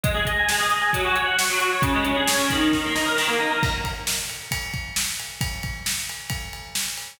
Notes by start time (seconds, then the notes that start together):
0.04 G#3, kick, closed hi-hat
0.14 G#4
0.25 D#5, kick, closed hi-hat
0.39 G#5
0.49 G#3, snare
0.59 G#4
0.70 D#5, closed hi-hat
0.82 G#5
0.93 F#3, kick, closed hi-hat
1.05 F#4
1.15 C#5, closed hi-hat
1.25 F#5
1.38 C#6, snare
1.50 F#3
1.59 F#4, closed hi-hat
1.72 C#5
1.82 C#3, kick, closed hi-hat
1.94 G#3
2.05 C#4, closed hi-hat
2.16 G#4
2.27 C#5, snare
2.37 C#3
2.50 D#3, kick, closed hi-hat
2.73 kick, snare
2.85 A#3
2.95 D#4, snare
3.06 A#4
3.16 D#3, snare
3.28 A#3
3.39 D#4
3.51 A#4
3.63 kick, crash
3.84 kick, ride
4.07 snare
4.29 ride
4.51 kick, ride
4.74 kick, ride
4.96 snare
5.19 ride
5.41 kick, ride
5.63 kick, ride
5.86 snare
6.09 ride
6.30 kick, ride
6.53 ride
6.75 snare
6.97 ride